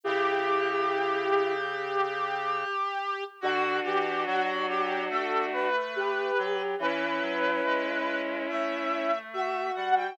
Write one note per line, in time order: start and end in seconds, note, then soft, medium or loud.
0.04 2.64 C#3 loud
0.04 1.53 E4 medium
0.04 1.53 G4 loud
0.04 3.24 G4 medium
3.41 3.80 D3 loud
3.41 5.69 D4 loud
3.41 3.79 F#4 medium
3.41 5.69 F#4 loud
3.83 4.25 E3 loud
3.83 4.24 G4 medium
4.26 5.08 F#3 loud
4.26 4.66 F#4 medium
4.68 5.04 G4 medium
5.10 6.31 A3 loud
5.10 5.45 A4 medium
5.53 6.62 B4 medium
5.95 6.75 G4 loud
6.38 6.75 F#3 loud
6.78 7.20 E3 loud
6.78 9.11 C#4 loud
6.78 9.11 E4 loud
6.78 8.21 B4 medium
7.21 7.61 F#3 loud
7.65 8.47 G#3 loud
8.49 9.71 A3 loud
8.49 9.18 E5 medium
9.33 10.14 F#4 loud
9.33 9.72 E5 medium
9.74 10.10 G3 medium
9.74 9.95 F#5 medium
9.96 10.16 G5 medium